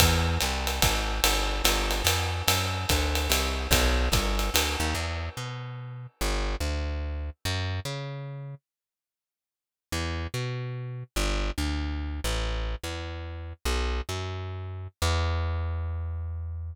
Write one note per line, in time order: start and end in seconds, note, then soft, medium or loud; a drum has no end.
0.00 0.38 E2 loud
0.00 kick medium
0.00 ride medium
0.41 0.80 C2 medium
0.41 hi-hat pedal medium
0.41 ride medium
0.67 ride medium
0.82 1.21 G#1 medium
0.82 kick medium
0.82 ride medium
1.24 1.62 G1 medium
1.24 ride medium
1.64 2.02 G1 medium
1.64 hi-hat pedal medium
1.64 ride medium
1.91 ride medium
2.04 2.43 F2 medium
2.04 ride medium
2.48 2.86 F#2 medium
2.48 ride medium
2.89 3.28 D2 medium
2.89 kick soft
2.89 hi-hat pedal medium
2.89 ride medium
3.15 ride medium
3.29 3.68 C2 medium
3.29 ride medium
3.71 4.09 B1 loud
3.71 kick soft
3.71 ride medium
4.12 4.50 G1 medium
4.12 kick medium
4.12 hi-hat pedal medium
4.12 ride medium
4.39 ride medium
4.54 4.76 D2 medium
4.54 ride medium
4.80 4.94 D#2 medium
4.95 5.29 E2 medium
5.37 6.07 B2 medium
6.21 6.56 G1 medium
6.60 7.30 D2 medium
7.45 7.80 F#2 medium
7.85 8.55 C#3 medium
9.92 10.27 E2 medium
10.34 11.04 B2 medium
11.16 11.51 G1 medium
11.58 12.20 D2 medium
12.24 12.75 A1 medium
12.84 13.53 E2 medium
13.65 14.01 B1 medium
14.09 14.88 F#2 medium
15.02 16.74 E2 loud